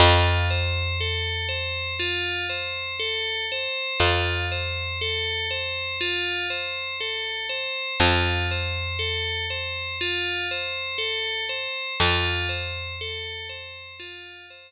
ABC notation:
X:1
M:4/4
L:1/8
Q:1/4=60
K:Flyd
V:1 name="Tubular Bells"
F c A c F c A c | F c A c F c A c | F c A c F c A c | F c A c F c z2 |]
V:2 name="Electric Bass (finger)" clef=bass
F,,8 | F,,8 | F,,8 | F,,8 |]